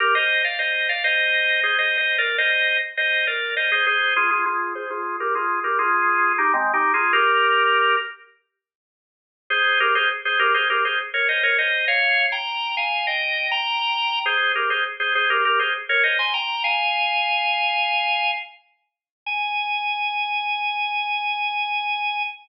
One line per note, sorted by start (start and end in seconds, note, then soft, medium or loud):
0.00 0.14 G4 loud
0.00 0.14 A#4 loud
0.15 0.42 C5 medium
0.15 0.42 D#5 loud
0.44 0.58 D5 medium
0.44 0.58 F5 medium
0.59 0.88 C5 medium
0.59 0.88 D#5 medium
0.89 1.03 D5 medium
0.89 1.03 F5 medium
1.04 1.60 C5 medium
1.04 1.60 D#5 loud
1.63 1.77 G#4 medium
1.63 1.77 C5 loud
1.78 1.97 C5 medium
1.78 1.97 D#5 medium
1.98 2.16 C5 medium
1.98 2.16 D#5 loud
2.18 2.37 A#4 medium
2.18 2.37 D5 loud
2.38 2.77 C5 medium
2.38 2.77 D#5 loud
2.97 3.25 C5 medium
2.97 3.25 D#5 loud
3.27 3.55 A#4 medium
3.27 3.55 D5 medium
3.57 3.71 C5 medium
3.57 3.71 D#5 medium
3.72 3.86 G#4 medium
3.72 3.86 C5 loud
3.86 4.14 G#4 medium
3.86 4.14 C5 loud
4.16 4.30 F4 medium
4.16 4.30 G#4 loud
4.31 4.45 F4 medium
4.31 4.45 G#4 medium
4.46 4.73 F4 medium
4.46 4.73 G#4 loud
4.75 4.89 G#4 loud
4.75 4.89 C5 loud
4.90 5.16 F4 medium
4.90 5.16 G#4 loud
5.20 5.34 G4 medium
5.20 5.34 A#4 loud
5.35 5.59 F4 medium
5.35 5.59 G#4 loud
5.64 5.78 G4 medium
5.64 5.78 A#4 medium
5.79 6.33 F4 loud
5.79 6.33 G#4 loud
6.38 6.52 D#4 medium
6.38 6.52 G4 loud
6.54 6.72 G#3 medium
6.54 6.72 C4 loud
6.74 6.92 D#4 medium
6.74 6.92 G4 medium
6.94 7.12 F4 medium
6.94 7.12 G#4 loud
7.13 7.96 G4 loud
7.13 7.96 A#4 loud
9.50 9.79 G#4 loud
9.50 9.79 C5 loud
9.80 9.94 G4 medium
9.80 9.94 A#4 loud
9.95 10.09 G#4 loud
9.95 10.09 C5 loud
10.25 10.39 G#4 medium
10.25 10.39 C5 loud
10.39 10.53 G4 loud
10.39 10.53 A#4 loud
10.54 10.68 G#4 medium
10.54 10.68 C5 loud
10.70 10.84 G4 medium
10.70 10.84 A#4 loud
10.85 10.99 G#4 medium
10.85 10.99 C5 medium
11.14 11.28 A#4 medium
11.14 11.28 C#5 medium
11.29 11.43 C5 medium
11.29 11.43 D#5 medium
11.43 11.57 A#4 medium
11.43 11.57 C#5 loud
11.58 11.85 C5 medium
11.58 11.85 D#5 medium
11.88 12.26 C#5 loud
11.88 12.26 F5 loud
12.32 12.75 G5 medium
12.32 12.75 A#5 medium
12.77 13.06 F5 medium
12.77 13.06 G#5 loud
13.07 13.48 D#5 medium
13.07 13.48 G5 loud
13.51 14.19 G5 loud
13.51 14.19 A#5 loud
14.26 14.52 G#4 medium
14.26 14.52 C5 loud
14.55 14.70 G4 medium
14.55 14.70 A#4 medium
14.70 14.84 G#4 medium
14.70 14.84 C5 medium
15.00 15.14 G#4 medium
15.00 15.14 C5 medium
15.15 15.29 G#4 medium
15.15 15.29 C5 loud
15.30 15.44 G4 medium
15.30 15.44 A#4 loud
15.45 15.59 G4 medium
15.45 15.59 A#4 loud
15.59 15.74 G#4 medium
15.59 15.74 C5 medium
15.89 16.03 A#4 loud
15.89 16.03 C#5 loud
16.03 16.18 C5 medium
16.03 16.18 D#5 medium
16.19 16.33 G#5 medium
16.19 16.33 C6 medium
16.34 16.63 G5 medium
16.34 16.63 A#5 loud
16.64 18.31 F5 loud
16.64 18.31 G#5 loud
19.26 22.23 G#5 loud